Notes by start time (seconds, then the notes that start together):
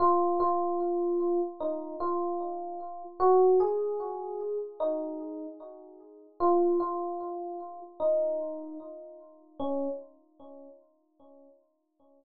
0.00 F4
0.40 F4
1.61 D#4
2.00 F4
3.20 F#4
3.60 G#4
4.80 D#4
6.40 F4
6.80 F4
8.00 D#4
9.60 C#4